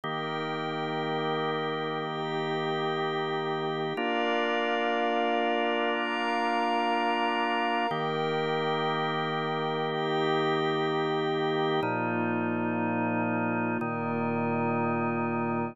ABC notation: X:1
M:6/8
L:1/8
Q:3/8=61
K:Bbmix
V:1 name="Drawbar Organ"
[E,B,G]6- | [E,B,G]6 | [B,DF]6- | [B,DF]6 |
[E,B,G]6- | [E,B,G]6 | [B,,F,E]6 | [B,,E,E]6 |]
V:2 name="Pad 5 (bowed)"
[EBg]6 | [EGg]6 | [Bdf]6 | [Bfb]6 |
[EBg]6 | [EGg]6 | [B,EF]6 | [B,FB]6 |]